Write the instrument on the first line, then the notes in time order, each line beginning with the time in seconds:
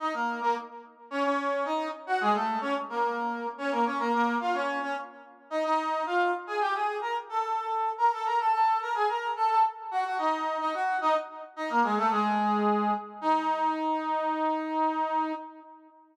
brass section
0.00 D#4 D#5
0.14 A#3 A#4
0.41 A#3 A#4
1.11 C#4 C#5
1.24 C#4 C#5
1.65 D#4 D#5
2.07 F#4 F#5
2.21 G#3 G#4
2.34 A3 A4
2.61 C#4 C#5
2.89 A#3 A#4
3.58 C#4 C#5
3.72 A#3 A#4
3.85 C#4 C#5
3.99 A#3 A#4
4.13 A#3 A#4
4.41 F4 F5
4.54 C#4 C#5
4.82 C#4 C#5
5.50 D#4 D#5
5.64 D#4 D#5
6.06 F4 F5
6.47 G#4 G#5
6.61 G4 G5
6.75 G#4 G#5
7.01 A#4 A#5
7.29 A4 A5
7.98 A#4 A#5
8.12 A4 A5
8.25 A#4 A#5
8.39 A4 A5
8.53 A4 A5
8.81 A#4 A#5
8.95 G#4 G#5
9.08 A#4 A#5
9.36 A4 A5
9.49 A4 A5
9.91 F#4 F#5
10.05 F#4 F#5
10.18 D#4 D#5
10.60 D#4 D#5
10.74 F#4 F#5
11.01 D#4 D#5
11.56 D#4 D#5
11.70 A#3 A#4
11.83 G#3 G#4
11.97 A3 A4
12.11 G#3 G#4
13.21 D#4